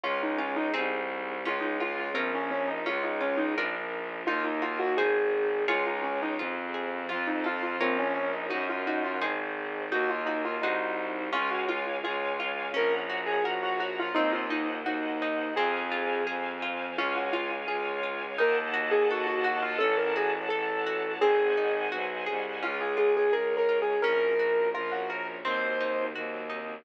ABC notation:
X:1
M:2/4
L:1/16
Q:1/4=85
K:Db
V:1 name="Acoustic Grand Piano"
F E D E z4 | F E F F C D D E | F E D E z4 | F E F G A4 |
F E D E z4 | F E F F C D D E | G F E F z4 | G F E F E4 |
F G F z F4 | B z2 A G G G F | E F E z E4 | A4 z4 |
F G F z F4 | B z2 A G G G F | =A B _A z =A4 | A4 z4 |
F A A A (3B2 B2 A2 | B4 F G B z | c4 z4 |]
V:2 name="Orchestral Harp"
D2 F2 [CEA]4 | D2 F2 [DFB]4 | D2 F2 [=DFB]4 | E2 G2 [EAc]4 |
[FAd]4 F2 A2 | F2 =A2 [FBd]4 | E2 G2 [EAc]4 | E2 G2 [EGc]4 |
D2 F2 A2 F2 | D2 G2 B2 G2 | C2 E2 G2 E2 | C2 F2 A2 F2 |
D2 F2 A2 F2 | E2 G2 =A2 G2 | D2 G2 =A2 G2 | C2 E2 G2 A2 |
D2 F2 A2 F2 | D2 G2 B2 G2 | C2 E2 G2 E2 |]
V:3 name="Violin" clef=bass
D,,4 C,,4 | D,,4 B,,,4 | D,,4 B,,,4 | E,,4 A,,,4 |
D,,4 F,,4 | F,,4 B,,,4 | G,,4 A,,,4 | E,,4 C,,4 |
D,,4 D,,4 | B,,,4 B,,,4 | E,,4 E,,4 | F,,4 F,,4 |
D,,4 D,,4 | E,,4 E,,4 | =A,,,4 A,,,4 | A,,,4 =B,,,2 C,,2 |
D,,4 D,,4 | B,,,4 B,,,4 | E,,4 E,,4 |]
V:4 name="String Ensemble 1"
[DFA]4 [CEA]4 | [DFA]4 [DFB]4 | [DFA]4 [=DFB]4 | [EGB]4 [EAc]4 |
[FAd]4 [FAc]4 | [F=Ac]4 [FBd]4 | [EGB]4 [EAc]4 | [EGB]4 [EGc]4 |
[dfa]8 | [dgb]8 | [ceg]8 | [cfa]8 |
[dfa]8 | [eg=a]8 | [dg=a]8 | [cega]8 |
[DFA]4 [DAd]4 | [DGB]4 [DBd]4 | [CEG]4 [G,CG]4 |]